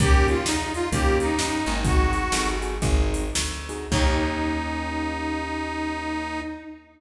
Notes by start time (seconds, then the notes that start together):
0.00 D#2 A#3 C#4 D#4 G4, kick, closed hi-hat
0.28 F4, closed hi-hat
0.46 E2 D#4, snare
0.74 F4, closed hi-hat
0.92 D#2 A#3 C#4 D#4 G4, kick, closed hi-hat
1.20 D#4, closed hi-hat
1.38 G2 A#3 C#4 D#4 G4, snare
1.66 G#1 A#3 C#4 D#4 G4, closed hi-hat
1.84 C4 D#4 F#4 G#4, kick, closed hi-hat
2.13 closed hi-hat
2.32 G1 C4 D#4 F#4 G#4, snare
2.62 C4 D#4 F#4 G#4, closed hi-hat
2.82 G#1 C4 D#4 F#4 G#4, kick, closed hi-hat
3.14 closed hi-hat
3.35 D2, snare
3.69 C4 D#4 F#4 G#4, closed hi-hat
3.91 D#2 A#3 C#4 D#4 G4, kick, crash